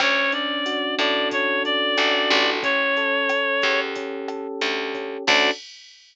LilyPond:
<<
  \new Staff \with { instrumentName = "Clarinet" } { \time 4/4 \key d \major \tempo 4 = 91 cis''8 d''4 d''8 cis''8 d''4. | cis''2 r2 | d''4 r2. | }
  \new Staff \with { instrumentName = "Electric Piano 1" } { \time 4/4 \key d \major cis'8 d'8 fis'8 a'8 cis'8 d'8 fis'8 a'8 | cis'8 a'8 cis'8 g'8 cis'8 a'8 g'8 cis'8 | <cis' d' fis' a'>4 r2. | }
  \new Staff \with { instrumentName = "Electric Bass (finger)" } { \clef bass \time 4/4 \key d \major d,4. a,4. a,,8 a,,8~ | a,,4. e,4. d,4 | d,4 r2. | }
  \new DrumStaff \with { instrumentName = "Drums" } \drummode { \time 4/4 <hh bd ss>8 hh8 hh8 <hh bd ss>8 <hh bd>8 hh8 <hh ss>8 <hh bd>8 | <hh bd>8 hh8 <hh ss>8 <hh bd>8 <hh bd>8 <hh ss>8 hh8 <hh bd>8 | <cymc bd>4 r4 r4 r4 | }
>>